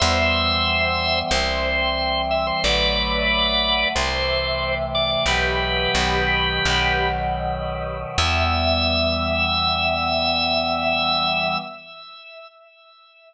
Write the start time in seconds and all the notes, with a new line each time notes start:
0.00 E2 E3 G3 B3 C5 E5
1.31 C2 E3 G3 C4 C5
2.31 E5
2.47 C5
2.64 A1 D3 F#3 A3 B4 D5
3.95 C2 C3 E3 A3 C5
4.95 D5
5.11 D5
5.26 B1 B2 E3 F#3 G4 B4
5.95 B1 B2 D#3 F#3
6.65 B1 B2 D#3 F#3
8.18 E2 E3 G3 B3 E5